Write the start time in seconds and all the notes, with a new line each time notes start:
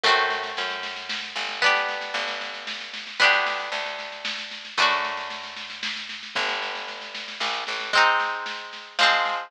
0.04 F#2 A3 C4, kick, snare
0.08 F#4
0.17 snare
0.30 snare
0.43 snare
0.57 F#2, snare
0.70 snare
0.83 snare
0.96 snare
1.09 snare
1.22 snare
1.36 G1, snare
1.49 snare
1.62 B3 D4, kick, snare
1.66 G4
1.75 snare
1.88 snare
2.01 snare
2.14 G1, snare
2.28 snare
2.41 snare
2.54 snare
2.67 snare
2.80 snare
2.94 snare
3.07 snare
3.20 D2 B3 D4, kick, snare
3.24 G4
3.33 snare
3.46 snare
3.60 snare
3.72 D2, snare
3.86 snare
3.99 snare
4.12 snare
4.25 snare
4.38 snare
4.51 snare
4.65 snare
4.77 F#2 A3 D4, kick, snare
4.82 F#4
4.90 snare
5.04 snare
5.17 snare
5.30 snare
5.44 snare
5.56 snare
5.70 snare
5.83 snare
5.96 snare
6.09 snare
6.23 snare
6.35 G1 B3 D4, kick, snare
6.40 G4
6.48 snare
6.62 snare
6.75 snare
6.88 snare
7.01 snare
7.14 snare
7.28 snare
7.40 A#1, snare
7.54 snare
7.67 A1, snare
7.80 snare
7.93 G#3 C4, kick, snare
7.97 D#4
8.20 snare
8.46 snare
8.73 snare
8.99 F3 G#3, snare
9.03 C4
9.25 snare